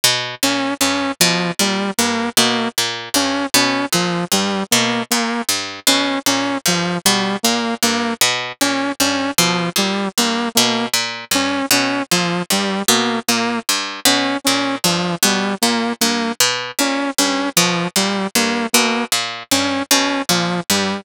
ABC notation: X:1
M:9/8
L:1/8
Q:3/8=51
K:none
V:1 name="Pizzicato Strings" clef=bass
B,, _B,, G,, =B,, _B,, G,, =B,, _B,, G,, | B,, _B,, G,, =B,, _B,, G,, =B,, _B,, G,, | B,, _B,, G,, =B,, _B,, G,, =B,, _B,, G,, | B,, _B,, G,, =B,, _B,, G,, =B,, _B,, G,, |
B,, _B,, G,, =B,, _B,, G,, =B,, _B,, G,, | B,, _B,, G,, =B,, _B,, G,, =B,, _B,, G,, |]
V:2 name="Lead 2 (sawtooth)"
z _D D F, G, _B, B, z D | _D F, G, _B, B, z D D F, | G, _B, B, z _D D F, G, B, | _B, z _D D F, G, B, B, z |
_D D F, G, _B, B, z D D | F, G, _B, B, z _D D F, G, |]